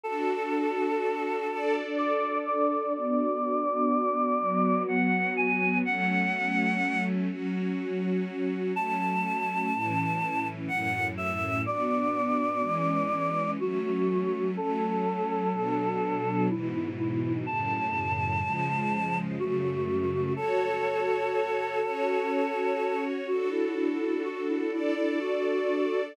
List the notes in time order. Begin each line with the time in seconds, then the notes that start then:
0.03 D4 F#4 A4
1.50 D4 A4 D5
1.98 D5
2.45 D5
2.94 B3 D4 F#4 D5
4.39 F#3 B3 F#4
4.88 F#5
5.36 G#5
5.85 F#3 A3 C#4 F#5
7.29 F#3 C#4 F#4
8.76 F#3 A3 C#4 A5
9.74 A2 E3 C#4
10.68 F#2 A2 C#4 F#5
11.17 E5
11.66 B3 D4 F#4 D5
12.61 E3 G#3 C#4
13.59 F#3 A3 C#4 F#4
14.57 F#3 A3 C#4 A4
15.52 B2 F#3 D4
16.49 G#2 B2 E3 E4
16.98 E4
17.46 F#2 A2 C#3 A5
18.44 C#3 F3 G#3
19.38 F#2 C#3 A3 F#4
20.36 F#4 A4 C#5
21.83 C#4 F#4 C#5
23.27 D4 F#4 A4
23.50 E4
23.76 E4
24.00 E4
24.24 F#4
24.48 E4
24.71 D4 E4 A4 D5
24.96 E4
25.21 F#4